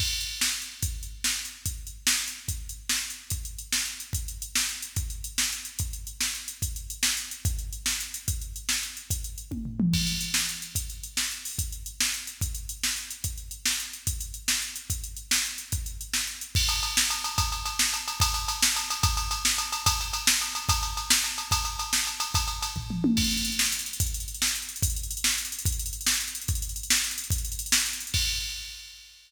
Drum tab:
CC |x-----------|------------|------------|------------|
RD |------------|------------|------------|------------|
HH |---x-----x--|x--x-----x--|x--x-----x--|x--x-----x--|
SD |------o-----|------o-----|------o-----|------o-----|
T1 |------------|------------|------------|------------|
T2 |------------|------------|------------|------------|
FT |------------|------------|------------|------------|
BD |o-----------|o-----------|o-----------|o-----------|

CC |------------|------------|------------|------------|
RD |------------|------------|------------|------------|
HH |x-x-x---x-x-|x-x-x---x-x-|x-x-x---x-x-|x-x-x---x-x-|
SD |------o-----|------o-----|------o-----|------o-----|
T1 |------------|------------|------------|------------|
T2 |------------|------------|------------|------------|
FT |------------|------------|------------|------------|
BD |o-----------|o-----------|o-----------|o-----------|

CC |------------|------------|------------|------------|
RD |------------|------------|------------|------------|
HH |x-x-x---x-x-|x-x-x---x-x-|x-x-x---x-x-|x-x-x-------|
SD |------o-----|------o-----|------o-----|------------|
T1 |------------|------------|------------|------o-----|
T2 |------------|------------|------------|----------o-|
FT |------------|------------|------------|--------o---|
BD |o-----------|o-----------|o-----------|o-----o-----|

CC |x-----------|------------|------------|------------|
RD |------------|------------|------------|------------|
HH |--x-x---x-x-|x-x-x---x-o-|x-x-x---x-x-|x-x-x---x-x-|
SD |------o-----|------o-----|------o-----|------o-----|
T1 |------------|------------|------------|------------|
T2 |------------|------------|------------|------------|
FT |------------|------------|------------|------------|
BD |o-----------|o-----------|o-----------|o-----------|

CC |------------|------------|------------|------------|
RD |------------|------------|------------|------------|
HH |x-x-x---x-x-|x-x-x---x-x-|x-x-x---x-x-|x-x-x---x-x-|
SD |------o-----|------o-----|------o-----|------o-----|
T1 |------------|------------|------------|------------|
T2 |------------|------------|------------|------------|
FT |------------|------------|------------|------------|
BD |o-----------|o-----------|o-----------|o-----------|

CC |x-----------|------------|------------|------------|
RD |--x-x---x-x-|x-x-x---x-x-|x-x-x---x-x-|x-x-x---x-x-|
HH |------------|------------|------------|------------|
SD |------o-----|------o-----|------o-----|------o-----|
T1 |------------|------------|------------|------------|
T2 |------------|------------|------------|------------|
FT |------------|------------|------------|------------|
BD |o-----------|o-----------|o-----------|o-----------|

CC |------------|------------|------------|------------|
RD |x-x-x---x-x-|x-x-x---x-x-|x-x-x---x-x-|x-x-x-------|
HH |------------|------------|------------|------------|
SD |------o-----|------o-----|------o-----|------------|
T1 |------------|------------|------------|----------o-|
T2 |------------|------------|------------|--------o---|
FT |------------|------------|------------|------o-----|
BD |o-----------|o-----------|o-----------|o-----o-----|

CC |x-----------|------------|------------|------------|
RD |------------|------------|------------|------------|
HH |-xxxxx-xxxxx|xxxxxx-xxxxx|xxxxxx-xxxxx|xxxxxx-xxxxx|
SD |------o-----|------o-----|------o-----|------o-----|
T1 |------------|------------|------------|------------|
T2 |------------|------------|------------|------------|
FT |------------|------------|------------|------------|
BD |o-----------|o-----------|o-----------|o-----------|

CC |------------|------------|x-----------|
RD |------------|------------|------------|
HH |xxxxxx-xxxxx|xxxxxx-xxxxx|------------|
SD |------o-----|------o-----|------------|
T1 |------------|------------|------------|
T2 |------------|------------|------------|
FT |------------|------------|------------|
BD |o-----------|o-----------|o-----------|